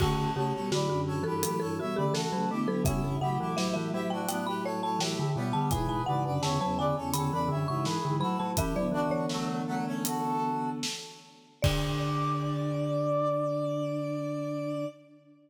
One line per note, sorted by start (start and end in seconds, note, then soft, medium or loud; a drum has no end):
0.00 0.32 C#3 medium
0.00 0.30 D3 loud
0.00 0.32 A3 medium
0.00 0.30 F#4 loud
0.00 0.32 F#4 loud
0.00 0.32 A4 loud
0.00 kick medium
0.00 crash medium
0.35 0.52 C#3 medium
0.35 0.53 C#3 loud
0.35 0.52 A3 medium
0.35 0.71 G4 medium
0.35 0.53 A4 medium
0.35 0.53 C#5 loud
0.53 0.73 B2 medium
0.53 0.73 G3 medium
0.53 0.70 A4 medium
0.53 0.70 C#5 medium
0.71 0.88 A2 medium
0.71 1.19 D3 medium
0.71 0.88 F#3 medium
0.71 0.89 F#4 loud
0.71 1.01 B4 medium
0.71 1.01 D5 medium
0.71 snare medium
0.88 1.22 F#2 medium
0.88 1.22 D3 medium
0.88 1.24 F#4 medium
1.07 1.24 A4 medium
1.07 1.24 C#5 loud
1.23 1.43 G2 medium
1.23 1.82 E3 medium
1.23 1.43 E3 medium
1.23 1.42 G4 medium
1.23 1.40 A4 loud
1.23 1.42 B4 medium
1.43 1.60 A2 medium
1.43 1.60 F#3 medium
1.43 1.60 G4 medium
1.43 1.59 A4 medium
1.43 1.60 B4 medium
1.43 closed hi-hat loud
1.60 1.78 G2 medium
1.60 1.78 E3 medium
1.60 1.77 A4 medium
1.60 1.77 C#5 loud
1.79 1.97 B2 medium
1.79 1.97 G3 medium
1.79 1.96 F#4 medium
1.79 1.96 C#5 medium
1.79 1.96 E5 medium
1.95 2.25 C#3 medium
1.95 2.16 D3 medium
1.95 2.25 A3 medium
1.95 2.13 G4 medium
1.95 2.13 B4 medium
1.95 2.13 D5 medium
2.14 2.31 E3 medium
2.14 2.49 F#4 medium
2.14 2.49 A4 loud
2.14 2.47 A4 medium
2.14 snare loud
2.32 2.49 C#3 medium
2.32 2.49 F#3 medium
2.32 2.49 A3 medium
2.50 2.68 D3 medium
2.50 2.68 A3 medium
2.50 2.68 B3 medium
2.50 2.82 E4 medium
2.50 2.82 G4 medium
2.68 2.86 D3 medium
2.68 2.85 F#3 medium
2.68 2.86 B3 medium
2.68 2.85 A4 loud
2.84 3.02 B2 medium
2.84 3.18 C#3 loud
2.84 3.02 G3 medium
2.84 3.16 C#4 loud
2.84 3.16 E4 loud
2.84 3.16 E5 loud
2.84 kick medium
2.84 closed hi-hat medium
3.02 3.19 G2 medium
3.02 3.19 E3 medium
3.21 5.22 A2 medium
3.21 3.38 C#3 medium
3.21 5.22 F#3 medium
3.21 3.38 E4 medium
3.21 3.38 G4 loud
3.21 3.56 F#5 medium
3.39 3.57 E3 medium
3.39 3.56 E4 medium
3.39 3.56 G4 medium
3.57 3.75 F#3 medium
3.57 3.89 E4 medium
3.57 3.89 G4 medium
3.57 3.73 E5 loud
3.57 snare medium
3.74 3.93 E3 medium
3.74 4.04 E5 loud
3.93 4.28 F#3 medium
3.93 4.10 E4 medium
3.93 4.10 G4 loud
4.10 4.28 D4 medium
4.10 4.28 F#4 medium
4.10 4.27 G5 medium
4.29 4.46 B3 medium
4.29 4.46 D4 medium
4.29 4.46 G5 medium
4.29 closed hi-hat medium
4.47 4.64 G4 medium
4.47 4.64 B4 loud
4.47 4.64 B5 medium
4.64 4.81 A4 loud
4.64 4.81 C#5 loud
4.64 4.82 C#5 medium
4.82 4.99 A4 medium
4.82 4.99 C#5 loud
4.82 5.00 A5 medium
4.99 5.16 E3 medium
4.99 5.29 E4 medium
4.99 5.29 G4 medium
4.99 5.33 G5 medium
4.99 snare loud
5.19 5.36 D3 medium
5.36 5.53 B2 medium
5.36 5.70 G3 medium
5.36 5.70 B3 medium
5.53 5.71 D3 medium
5.53 5.70 A5 loud
5.71 6.01 G#2 medium
5.71 5.88 B2 loud
5.71 6.01 E3 medium
5.71 6.01 G#4 loud
5.71 6.01 B4 loud
5.71 5.88 G#5 loud
5.71 kick medium
5.71 closed hi-hat medium
5.88 6.05 B2 medium
5.88 6.06 G#5 medium
6.06 6.24 G#2 medium
6.06 6.39 C#3 medium
6.06 6.24 E3 medium
6.06 6.24 B4 medium
6.06 6.24 D5 medium
6.06 6.40 F#5 medium
6.25 6.42 F#2 medium
6.25 6.42 D3 medium
6.25 6.42 B4 medium
6.25 6.42 D5 medium
6.42 6.59 E2 medium
6.42 6.59 C#3 medium
6.42 6.59 D3 medium
6.42 6.77 C#5 medium
6.42 6.77 E5 loud
6.42 6.60 A5 medium
6.42 snare medium
6.61 6.94 E2 medium
6.61 6.94 C#3 medium
6.61 6.78 F#3 medium
6.61 6.78 A5 loud
6.78 6.97 D3 medium
6.78 6.95 B4 medium
6.78 6.95 D5 loud
6.78 7.10 G#5 medium
6.96 7.13 E2 medium
6.96 7.13 C#3 medium
6.96 7.13 A4 medium
6.96 7.13 C#5 loud
7.14 7.31 E2 medium
7.14 7.31 C#3 medium
7.14 7.31 D3 medium
7.14 7.31 A4 medium
7.14 7.31 C#5 loud
7.14 7.65 B5 medium
7.14 closed hi-hat medium
7.32 7.49 E2 medium
7.32 7.49 C#3 medium
7.32 7.50 E3 medium
7.32 7.49 B4 loud
7.32 7.49 D5 loud
7.48 7.67 F#2 medium
7.48 7.65 D3 medium
7.48 7.67 D3 medium
7.48 7.67 C#5 medium
7.48 7.67 E5 loud
7.68 7.98 G#2 medium
7.68 7.87 C#3 medium
7.68 7.98 E3 medium
7.68 7.85 C#5 medium
7.68 7.85 E5 medium
7.68 7.85 C#6 medium
7.85 8.03 E3 medium
7.85 8.16 G#4 medium
7.85 8.16 B4 medium
7.85 snare medium
8.05 8.22 G#2 medium
8.05 8.22 D3 medium
8.05 8.22 E3 medium
8.20 8.38 A2 medium
8.20 8.37 F#3 medium
8.20 8.38 F#3 medium
8.20 8.51 F#4 medium
8.20 8.51 A4 loud
8.20 8.38 B5 loud
8.39 8.56 A2 medium
8.39 8.56 F#3 medium
8.39 8.57 F#3 medium
8.39 8.56 A5 medium
8.56 8.73 E3 medium
8.56 8.75 E3 loud
8.56 8.73 C#4 medium
8.56 8.86 E4 medium
8.56 8.86 G4 loud
8.56 8.75 E5 loud
8.56 kick medium
8.56 closed hi-hat medium
8.76 10.83 D3 medium
8.76 8.93 F#3 medium
8.76 10.83 B3 medium
8.76 8.93 D5 medium
8.92 9.09 E3 medium
8.92 9.26 D4 medium
8.92 9.26 F#4 loud
9.10 10.54 E3 medium
9.10 9.93 C#5 loud
9.29 9.61 F#3 medium
9.29 9.61 A3 loud
9.29 snare medium
9.67 9.85 F#3 medium
9.67 9.85 A3 loud
9.86 10.04 A3 medium
9.86 10.04 C#4 loud
10.05 10.70 F#4 medium
10.05 10.70 A4 medium
10.05 closed hi-hat loud
10.83 snare loud
11.62 14.86 D3 loud
11.62 14.84 D4 loud
11.62 14.84 D5 loud
11.62 14.86 D5 loud
11.62 kick loud
11.62 crash loud